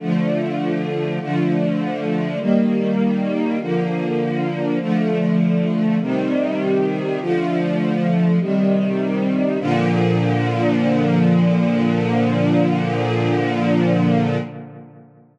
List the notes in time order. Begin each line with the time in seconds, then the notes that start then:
0.00 D3 F3 A3
1.20 D3 F3 A3
2.40 D#3 G3 A#3
3.60 D3 F3 A#3
4.80 D3 F3 A3
6.00 C3 D#3 G3
7.20 D3 F3 A3
8.39 C3 D#3 G3
9.60 A#2 D3 F3